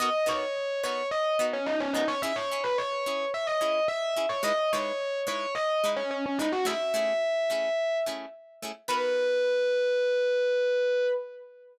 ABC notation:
X:1
M:4/4
L:1/16
Q:1/4=108
K:Bmix
V:1 name="Electric Piano 1"
d2 c4 c2 d2 z C D C D c | e c2 B c4 e d3 e3 c | d2 c4 c2 d2 z C C C D F | e10 z6 |
B16 |]
V:2 name="Pizzicato Strings"
[B,DF^A]2 [B,DFA]4 [B,DFA]4 [B,DFA]4 [B,DFA]2 | [CEG]2 [CEG]4 [CEG]4 [CEG]4 [CEG]2 | [G,DEB]2 [G,DEB]4 [G,DEB]4 [G,DEB]4 [G,DEB]2 | [A,CEG]2 [A,CEG]4 [A,CEG]4 [A,CEG]4 [A,CEG]2 |
[B,DF^A]16 |]